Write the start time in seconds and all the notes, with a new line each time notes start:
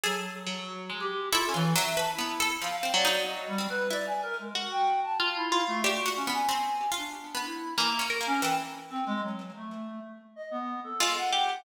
0.03 F#3 G#4 A4
0.47 F#3
0.90 G#3
1.00 G4
1.32 E4 F4 A4
1.49 C#4
1.54 E3 F4
1.75 F#3 E5
1.97 B4 A5
2.13 E4
2.19 B3
2.40 A4
2.62 F3 F5
2.78 F5
2.83 C4
2.94 F#3 D5
3.05 D#4
3.26 D#5
3.48 G3
3.58 C4
3.69 B4
3.90 E4 D5
4.07 G#5
4.23 A#4
4.39 G#3
4.55 F#4
4.71 G5
5.03 A5
5.20 F4
5.36 E4
5.52 F4
5.68 A3
5.84 D4 F#4 G4
6.06 F#4
6.16 C#4
6.27 B3
6.33 G#5
6.49 C4
6.92 F4
6.97 D4
7.35 B3
7.45 E4
7.78 E3 A#3
7.99 C#4
8.10 A#4
8.21 A#3
8.26 C#4
8.41 E3 G5
8.90 C4
9.06 G#3
9.23 F#3
9.56 A3
10.36 D#5
10.51 B3
10.84 A4
11.00 G#3 F4
11.17 F#5
11.33 G4